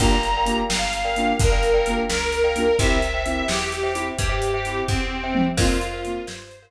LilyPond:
<<
  \new Staff \with { instrumentName = "Accordion" } { \time 6/8 \key f \major \tempo 4. = 86 bes''4. f''4. | bes'4. bes'4. | e''4. g'4. | g'4. c'4. |
f'4. c''4 r8 | }
  \new Staff \with { instrumentName = "Acoustic Grand Piano" } { \time 6/8 \key f \major <bes d' f' g'>4 <bes d' f' g'>4. <bes d' f' g'>8~ | <bes d' f' g'>4 <bes d' f' g'>4. <bes d' f' g'>8 | <c' e' g'>4 <c' e' g'>4. <c' e' g'>8~ | <c' e' g'>4 <c' e' g'>4. <c' e' g'>8 |
<bes c' f'>4 <bes c' f'>4. r8 | }
  \new Staff \with { instrumentName = "Glockenspiel" } { \time 6/8 \key f \major <bes' d'' f'' g''>16 <bes' d'' f'' g''>8 <bes' d'' f'' g''>4. <bes' d'' f'' g''>8.~ | <bes' d'' f'' g''>16 <bes' d'' f'' g''>8 <bes' d'' f'' g''>4. <bes' d'' f'' g''>8. | <c'' e'' g''>16 <c'' e'' g''>8 <c'' e'' g''>4. <c'' e'' g''>8.~ | <c'' e'' g''>16 <c'' e'' g''>8 <c'' e'' g''>4. <c'' e'' g''>8. |
<bes' c'' f''>16 <bes' c'' f''>8 <bes' c'' f''>4. <bes' c'' f''>8. | }
  \new Staff \with { instrumentName = "Electric Bass (finger)" } { \clef bass \time 6/8 \key f \major g,,4. g,,4. | g,,4. des,4. | c,4. e,4. | g,4. e,4. |
f,4. g,4. | }
  \new DrumStaff \with { instrumentName = "Drums" } \drummode { \time 6/8 <hh bd>8 hh8 hh8 sn8 hh8 hh8 | <hh bd>8 hh8 hh8 sn8 hh8 hh8 | <hh bd>8 hh8 hh8 sn8 hh8 hh8 | <hh bd>8 hh8 hh8 <bd tomfh>4 tommh8 |
<cymc bd>8 hh8 hh8 sn8 hh4 | }
>>